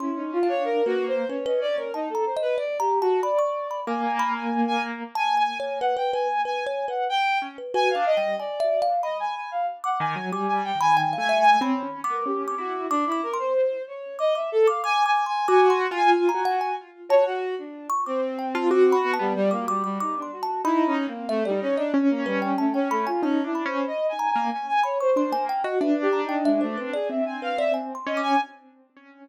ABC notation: X:1
M:4/4
L:1/16
Q:1/4=93
K:none
V:1 name="Violin"
E ^D F ^c (3^A2 ^F2 =c2 ^c ^d =d A ^D =A =c B | (3d2 G2 ^F2 d4 ^g3 g2 g z2 | (3^g2 g2 g2 ^f =g ^g2 (3g2 g2 f2 =g2 z2 | ^g f ^d2 =d3 z ^d g g f z ^f g2 |
^g g =g ^g (3g2 g2 g2 ^c2 z ^A =G2 ^F2 | D E ^A c3 ^c2 ^d e =A f (3^g2 g2 g2 | ^g2 z g (3g2 g2 g2 z2 ^c ^F2 D2 z | C6 B, G, G, ^A, G, G, ^D =D ^F2 |
(3E2 ^C2 ^A,2 =A, G, C D z ^A, G,2 =A, C A, F | (3^C2 E2 =c2 (3^d2 ^g2 g2 g g ^c =c3 z2 | (3B2 G2 ^D2 ^G, A, C ^G e ^g f e z2 ^d g |]
V:2 name="Acoustic Grand Piano"
(3^C4 D4 ^A,4 C4 z4 | z8 ^A,8 | z14 ^C z | (3^F2 D2 G,2 z10 ^D, ^F, |
(3G,4 ^D,4 A,4 (3C2 ^C2 B,2 C2 E2 | z16 | (3^F4 =F4 ^F4 z2 F2 z4 | z3 F ^F3 B, G,6 z2 |
(3^D4 C4 D4 ^C8 | (3^D2 =D2 ^C2 z3 ^A, z4 D A,2 ^F | D8 C6 ^C2 |]
V:3 name="Kalimba"
(3c'4 f4 B4 B B z ^c (3a2 ^a2 ^d2 | (3d2 ^a2 =a2 b ^c'2 b d' z b z5 | (3a2 ^g2 ^c2 B B B z (3B2 c2 B2 z3 B | (3B2 f2 g2 (3^g2 e2 f2 b4 z d'2 z |
d'2 z b g f e ^g (3b4 d'4 d'4 | (3d'2 d'2 c'2 z4 d' d' z d' (3d'2 d'2 c'2 | (3d'2 c'2 ^g2 z ^a ^f g z2 =a z4 ^c' | d' z g a (3d'2 b2 a2 z d' d' d' (3d'2 c'2 a2 |
b2 z2 e d z ^d z2 B g a g b ^g | a2 b4 ^a2 z2 b ^c' =c' ^g =g ^d | e z ^a g e c B d z2 B d (3^g2 c'2 d'2 |]